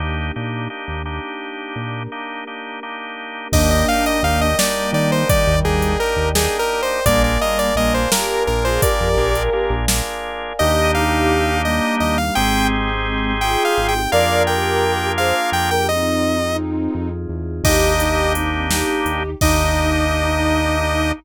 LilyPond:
<<
  \new Staff \with { instrumentName = "Lead 2 (sawtooth)" } { \time 5/8 \key ees \major \tempo 4 = 85 r2 r8 | r2 r8 | ees''16 ees''16 f''16 ees''16 f''16 ees''16 d''8 d''16 c''16 | d''8 aes'8 bes'8 \tuplet 3/2 { aes'8 bes'8 c''8 } |
d''16 d''16 ees''16 d''16 ees''16 c''16 bes'8 bes'16 c''16 | d''4 r4. | ees''8 f''4 ees''8 ees''16 f''16 | g''8 r4 \tuplet 3/2 { g''8 f''8 g''8 } |
f''8 g''4 f''8 g''16 g''16 | ees''4 r4. | ees''4 r4. | ees''2~ ees''8 | }
  \new Staff \with { instrumentName = "Ocarina" } { \time 5/8 \key ees \major r2 r8 | r2 r8 | <bes d'>4. <g bes>4 | <ees g>4 r4. |
<g bes>4 <g bes>8 <g' bes'>8 r16 <f' aes'>16 | <g' bes'>4. r4 | <ees' g'>4. <g bes>4 | <aes c'>4. <f' aes'>4 |
<bes' d''>8 <g' bes'>4 <aes' c''>16 r8 <g' bes'>16 | <c' ees'>2 r8 | <ees' g'>8 <ees' g'>8 <c' ees'>8 <ees' g'>4 | ees'2~ ees'8 | }
  \new Staff \with { instrumentName = "Drawbar Organ" } { \time 5/8 \key ees \major <bes d' ees' g'>8 <bes d' ees' g'>8 <bes d' ees' g'>8 <bes d' ees' g'>4~ | <bes d' ees' g'>8 <bes d' ees' g'>8 <bes d' ees' g'>8 <bes d' ees' g'>4 | <bes d' ees' g'>8 <bes d' ees' g'>8 <bes d' ees' g'>8 <bes d' ees' g'>4~ | <bes d' ees' g'>8 <bes d' ees' g'>8 <bes d' ees' g'>8 <bes d' ees' g'>4 |
<bes d' f' aes'>8 <bes d' f' aes'>8 <bes d' f' aes'>8 <bes d' f' aes'>4~ | <bes d' f' aes'>8 <bes d' f' aes'>8 <bes d' f' aes'>8 <bes d' f' aes'>4 | <bes d' ees' g'>2~ <bes d' ees' g'>8 | <c' ees' g' aes'>2~ <c' ees' g' aes'>8 |
<bes d' f' aes'>2~ <bes d' f' aes'>8 | r2 r8 | <bes d' ees' g'>2~ <bes d' ees' g'>8 | <bes d' ees' g'>2~ <bes d' ees' g'>8 | }
  \new Staff \with { instrumentName = "Synth Bass 1" } { \clef bass \time 5/8 \key ees \major ees,8 bes,8. ees,4~ ees,16 | bes,2~ bes,8 | ees,4 ees,4 ees8~ | ees16 ees,16 ees,8. ees,4~ ees,16 |
bes,,4 bes,,4 bes,,8~ | bes,,16 f,16 bes,,8. bes,,4~ bes,,16 | ees,2 ees,8 | aes,,2 aes,,8 |
f,2 f,8~ | f,4. f,8 e,8 | ees,2 ees,8 | ees,2~ ees,8 | }
  \new Staff \with { instrumentName = "Pad 5 (bowed)" } { \time 5/8 \key ees \major <bes d' ees' g'>2~ <bes d' ees' g'>8 | <bes d' g' bes'>2~ <bes d' g' bes'>8 | <bes' d'' ees'' g''>2~ <bes' d'' ees'' g''>8~ | <bes' d'' ees'' g''>2~ <bes' d'' ees'' g''>8 |
<bes' d'' f'' aes''>2~ <bes' d'' f'' aes''>8~ | <bes' d'' f'' aes''>2~ <bes' d'' f'' aes''>8 | <bes d' ees' g'>2~ <bes d' ees' g'>8 | <c' ees' g' aes'>2~ <c' ees' g' aes'>8 |
<bes d' f' aes'>2~ <bes d' f' aes'>8 | <c' ees' f' aes'>2~ <c' ees' f' aes'>8 | r2 r8 | r2 r8 | }
  \new DrumStaff \with { instrumentName = "Drums" } \drummode { \time 5/8 r4. r4 | r4. r4 | <cymc bd>8. hh8. sn4 | <hh bd>8. hh8. sn4 |
<hh bd>8. hh8. sn4 | <hh bd>8. hh8. sn4 | r4. r4 | r4. r4 |
r4. r4 | r4. r4 | <cymc bd>8 hh8 hh8 sn8 hh8 | <cymc bd>4. r4 | }
>>